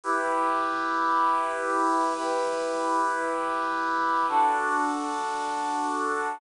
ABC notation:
X:1
M:4/4
L:1/8
Q:1/4=113
K:Em
V:1 name="Brass Section"
[EGB]8 | [EGB]8 | [DFA]8 |]